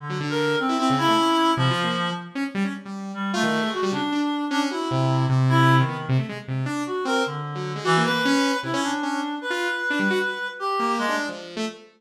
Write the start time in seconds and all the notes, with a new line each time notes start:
0.00 D3
0.09 F#3
0.20 D3
0.30 A#4
0.59 C4
0.69 E4
0.78 C4 E4
0.90 C#3
0.98 E4
1.08 A3
1.17 C#4
1.57 C3 F3
1.70 F4
1.83 A#3
2.35 C#4
2.54 G3
2.64 C#4
2.85 G3
3.14 G3
3.33 A3 F4
3.43 D#3
3.62 G#3
3.72 F#4
3.83 G3
3.92 C#3 D4
4.12 D4
4.50 C#4 D4
4.71 E4 F#4
4.91 C3
5.29 C3
5.49 E4
5.79 D#3
5.88 B3
6.09 C3
6.18 A3
6.29 G#3
6.48 C3
6.66 D4
6.86 F#4
7.05 C4 A#4
7.26 D3
7.55 F#3
7.75 G#3
7.84 E3 F#4
7.97 A#3
8.04 B4
8.09 A#3
8.25 C#4
8.63 C3 E4
8.73 C#4
8.82 D4
9.03 C#4
9.41 B4
9.50 F4
9.90 D4
9.99 G3
10.10 F#4
10.59 G4
10.79 A#3
10.98 G#3
11.08 D4
11.29 F3
11.56 A3